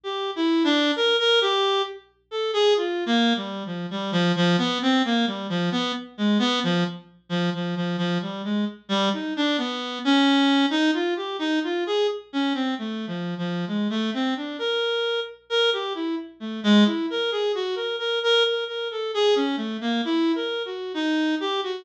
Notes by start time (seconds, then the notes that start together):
0.04 G4
0.36 E4
0.64 D4
0.96 A#4
1.19 A#4
1.41 G4
2.31 A4
2.53 G#4
2.77 F4
3.06 A#3
3.36 G3
3.66 F3
3.91 G3
4.12 F3
4.36 F3
4.58 B3
4.82 C4
5.05 A#3
5.27 G3
5.49 F3
5.72 B3
6.18 G#3
6.39 B3
6.63 F3
7.29 F3
7.54 F3
7.76 F3
7.98 F3
8.22 G3
8.44 G#3
8.89 G3
9.13 D#4
9.37 D4
9.58 B3
10.05 C#4
10.70 D#4
10.94 F4
11.16 G4
11.39 D#4
11.64 F4
11.87 G#4
12.33 C#4
12.54 C4
12.79 A3
13.07 F3
13.38 F3
13.68 G#3
13.90 A3
14.14 C4
14.37 D4
14.59 A#4
15.50 A#4
15.73 G4
15.95 E4
16.40 A3
16.64 G#3
16.86 E4
17.10 A#4
17.31 G#4
17.55 F#4
17.76 A#4
17.99 A#4
18.23 A#4
18.44 A#4
18.68 A#4
18.91 A4
19.14 G#4
19.36 C#4
19.57 A3
19.81 A#3
20.05 E4
20.35 A#4
20.65 F#4
20.94 D#4
21.40 G4
21.63 F#4